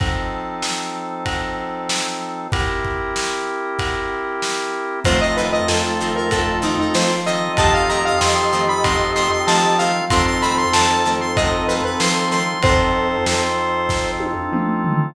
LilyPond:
<<
  \new Staff \with { instrumentName = "Lead 1 (square)" } { \time 4/4 \key f \major \tempo 4 = 95 r1 | r1 | c''16 ees''16 b'16 ees''16 a'8. bes'16 a'8 ees'16 ees'16 c''8 ees''8 | a''16 f''16 bes''16 f''16 c'''8. b''16 c'''8 c'''16 c'''16 a''8 f''8 |
c'''16 c'''16 b''16 c'''16 a''8. c'''16 ees''8 b'16 b'16 c'''8 c'''8 | c''2~ c''8 r4. | }
  \new Staff \with { instrumentName = "Lead 1 (square)" } { \time 4/4 \key f \major r1 | r1 | <a f'>1 | <g' ees''>1 |
<c' a'>1 | <c' a'>4. r2 r8 | }
  \new Staff \with { instrumentName = "Acoustic Guitar (steel)" } { \time 4/4 \key f \major r1 | r1 | <ees f a c'>8 <ees f a c'>8 <ees f a c'>8 <ees f a c'>8 <ees f a c'>8 <ees f a c'>8 <ees f a c'>8 <ees f a c'>8 | <ees f a c'>8 <ees f a c'>8 <ees f a c'>8 <ees f a c'>8 <ees f a c'>8 <ees f a c'>8 <ees f a c'>8 <ees f a c'>8 |
<ees f a c'>8 <ees f a c'>8 <ees f a c'>8 <ees f a c'>8 <ees f a c'>8 <ees f a c'>8 <ees f a c'>8 <ees f a c'>8 | r1 | }
  \new Staff \with { instrumentName = "Drawbar Organ" } { \time 4/4 \key f \major <f c' ees' a'>1 | <c' e' g' bes'>1 | <c' ees' f' a'>2.~ <c' ees' f' a'>8 <c' ees' f' a'>8~ | <c' ees' f' a'>1 |
<c' ees' f' a'>1 | <c' ees' f' a'>1 | }
  \new Staff \with { instrumentName = "Synth Bass 1" } { \clef bass \time 4/4 \key f \major r1 | r1 | f,4 f,2 f4 | f,4 f,2 f4 |
f,4 f,2 f4 | f,4 f,2 f4 | }
  \new Staff \with { instrumentName = "Pad 5 (bowed)" } { \time 4/4 \key f \major <f' c'' ees'' a''>1 | <c' g' e'' bes''>1 | <c'' ees'' f'' a''>1 | <c'' ees'' f'' a''>1 |
<c'' ees'' f'' a''>1 | <c'' ees'' f'' a''>1 | }
  \new DrumStaff \with { instrumentName = "Drums" } \drummode { \time 4/4 <bd cymr>4 sn4 <bd cymr>4 sn4 | <bd cymr>8 bd8 sn4 <bd cymr>4 sn4 | <bd cymr>4 sn4 <bd cymr>8 sn8 sn4 | <bd cymr>4 sn4 <bd cymr>8 sn8 sn4 |
<bd cymr>4 sn4 <bd cymr>8 sn8 sn4 | <bd cymr>4 sn4 <bd sn>8 tommh8 toml8 tomfh8 | }
>>